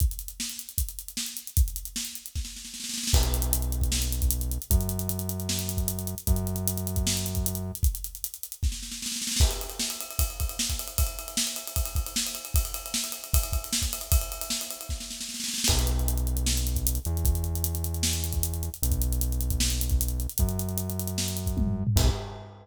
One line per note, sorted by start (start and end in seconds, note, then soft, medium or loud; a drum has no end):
0.00 kick loud
0.00 closed hi-hat medium
0.11 closed hi-hat medium
0.19 closed hi-hat medium
0.28 closed hi-hat medium
0.40 snare medium
0.50 closed hi-hat medium
0.59 closed hi-hat medium
0.69 closed hi-hat medium
0.78 kick medium
0.78 closed hi-hat loud
0.89 closed hi-hat medium
0.99 closed hi-hat medium
1.08 closed hi-hat medium
1.17 snare loud
1.26 closed hi-hat medium
1.37 closed hi-hat medium
1.47 closed hi-hat medium
1.57 kick loud
1.57 closed hi-hat loud
1.68 closed hi-hat medium
1.76 closed hi-hat medium
1.85 closed hi-hat medium
1.96 snare loud
2.05 closed hi-hat medium
2.15 closed hi-hat medium
2.26 closed hi-hat medium
2.35 kick medium
2.35 snare medium
2.45 snare medium
2.56 snare medium
2.65 snare medium
2.74 snare medium
2.80 snare medium
2.84 snare medium
2.89 snare medium
2.94 snare medium
2.98 snare medium
3.03 snare medium
3.07 snare loud
3.13 4.58 B1 medium
3.13 kick loud
3.13 crash loud
3.23 closed hi-hat medium
3.34 closed hi-hat medium
3.42 closed hi-hat medium
3.53 closed hi-hat loud
3.62 closed hi-hat medium
3.72 closed hi-hat medium
3.81 kick medium
3.81 closed hi-hat medium
3.92 snare loud
4.02 closed hi-hat medium
4.12 closed hi-hat medium
4.22 kick medium
4.22 closed hi-hat medium
4.31 closed hi-hat loud
4.41 closed hi-hat medium
4.51 closed hi-hat medium
4.62 closed hi-hat medium
4.71 6.15 F#2 medium
4.71 kick loud
4.71 closed hi-hat loud
4.81 closed hi-hat medium
4.89 closed hi-hat medium
4.99 closed hi-hat medium
5.09 closed hi-hat medium
5.19 closed hi-hat medium
5.29 closed hi-hat medium
5.40 closed hi-hat medium
5.49 snare loud
5.59 closed hi-hat medium
5.69 closed hi-hat medium
5.77 kick medium
5.77 closed hi-hat medium
5.88 closed hi-hat loud
5.99 closed hi-hat medium
6.07 closed hi-hat medium
6.18 closed hi-hat medium
6.27 7.72 F#2 medium
6.27 kick loud
6.27 closed hi-hat medium
6.36 closed hi-hat medium
6.47 closed hi-hat medium
6.56 closed hi-hat medium
6.67 closed hi-hat loud
6.77 closed hi-hat medium
6.87 closed hi-hat medium
6.96 kick medium
6.96 closed hi-hat medium
7.07 snare loud
7.17 closed hi-hat medium
7.26 closed hi-hat medium
7.35 kick medium
7.35 closed hi-hat medium
7.46 closed hi-hat loud
7.55 closed hi-hat medium
7.75 closed hi-hat medium
7.83 kick loud
7.83 closed hi-hat medium
7.95 closed hi-hat medium
8.04 closed hi-hat medium
8.15 closed hi-hat medium
8.24 closed hi-hat medium
8.34 closed hi-hat medium
8.43 closed hi-hat medium
8.52 closed hi-hat medium
8.63 kick medium
8.63 snare medium
8.72 snare medium
8.83 snare medium
8.92 snare medium
9.02 snare medium
9.06 snare medium
9.12 snare medium
9.16 snare medium
9.22 snare medium
9.27 snare medium
9.32 snare medium
9.36 kick loud
9.36 snare loud
9.41 crash medium
9.51 ride medium
9.61 ride medium
9.70 ride medium
9.79 snare loud
9.90 ride medium
10.01 ride medium
10.11 ride medium
10.19 kick medium
10.19 ride loud
10.30 ride medium
10.40 kick medium
10.40 ride medium
10.49 ride medium
10.59 snare loud
10.70 kick medium
10.70 ride medium
10.79 ride medium
10.88 ride medium
10.98 kick loud
10.98 ride loud
11.07 ride medium
11.19 ride medium
11.28 ride medium
11.37 snare loud
11.47 ride medium
11.56 ride medium
11.67 ride medium
11.76 kick medium
11.76 ride medium
11.86 ride medium
11.95 kick medium
11.95 ride medium
12.06 ride medium
12.16 snare loud
12.27 ride medium
12.35 ride medium
12.45 ride medium
12.54 kick loud
12.54 ride loud
12.65 ride medium
12.74 ride medium
12.86 ride medium
12.94 snare loud
13.04 ride medium
13.12 ride medium
13.24 ride medium
13.33 kick loud
13.33 ride loud
13.43 ride medium
13.53 kick medium
13.53 ride medium
13.64 ride medium
13.73 snare loud
13.82 kick medium
13.82 ride medium
13.93 ride medium
14.01 ride medium
14.12 kick loud
14.12 ride loud
14.21 ride medium
14.32 ride medium
14.41 ride medium
14.50 snare loud
14.61 ride medium
14.71 ride medium
14.81 ride medium
14.89 kick medium
14.89 snare medium
15.00 snare medium
15.10 snare medium
15.21 snare medium
15.29 snare medium
15.34 snare medium
15.40 snare medium
15.44 snare medium
15.48 snare medium
15.54 snare medium
15.58 snare medium
15.64 snare loud
15.64 crash loud
15.69 16.99 B1 medium
15.69 kick loud
15.79 closed hi-hat medium
15.87 closed hi-hat medium
15.99 closed hi-hat medium
16.08 closed hi-hat medium
16.17 closed hi-hat medium
16.27 closed hi-hat medium
16.37 closed hi-hat medium
16.46 snare loud
16.57 closed hi-hat medium
16.67 closed hi-hat medium
16.76 kick medium
16.76 closed hi-hat medium
16.87 closed hi-hat loud
16.95 closed hi-hat medium
17.05 18.70 E2 medium
17.05 closed hi-hat medium
17.17 closed hi-hat medium
17.25 kick loud
17.25 closed hi-hat medium
17.35 closed hi-hat medium
17.44 closed hi-hat medium
17.55 closed hi-hat medium
17.64 closed hi-hat loud
17.75 closed hi-hat medium
17.84 closed hi-hat medium
17.94 closed hi-hat medium
18.03 snare loud
18.13 closed hi-hat medium
18.24 closed hi-hat medium
18.33 kick medium
18.33 closed hi-hat medium
18.43 closed hi-hat loud
18.54 closed hi-hat medium
18.63 closed hi-hat medium
18.74 closed hi-hat medium
18.82 20.27 B1 medium
18.82 closed hi-hat loud
18.92 kick medium
18.92 closed hi-hat medium
19.02 closed hi-hat medium
19.13 closed hi-hat medium
19.21 closed hi-hat medium
19.32 closed hi-hat medium
19.41 closed hi-hat medium
19.50 kick medium
19.50 closed hi-hat medium
19.60 snare loud
19.70 closed hi-hat medium
19.81 closed hi-hat medium
19.90 kick medium
19.90 closed hi-hat medium
20.01 closed hi-hat loud
20.08 closed hi-hat medium
20.20 closed hi-hat medium
20.29 closed hi-hat medium
20.38 21.84 F#2 medium
20.38 kick loud
20.38 closed hi-hat loud
20.49 closed hi-hat medium
20.59 closed hi-hat medium
20.69 closed hi-hat medium
20.78 closed hi-hat medium
20.90 closed hi-hat medium
20.99 closed hi-hat medium
21.07 closed hi-hat medium
21.18 snare loud
21.28 closed hi-hat medium
21.37 closed hi-hat medium
21.46 kick medium
21.46 closed hi-hat medium
21.57 kick medium
21.57 high tom medium
21.67 floor tom medium
21.87 floor tom loud
21.96 22.10 B1 loud
21.96 kick loud
21.96 crash loud